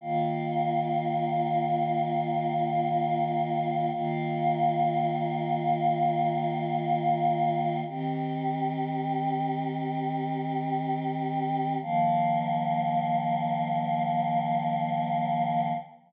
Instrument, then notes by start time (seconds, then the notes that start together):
choir aahs
0.01 D#3 A#3 F4
3.92 D#3 A#3 F4
7.87 D#3 C4 G4
11.81 D#3 F3 A#3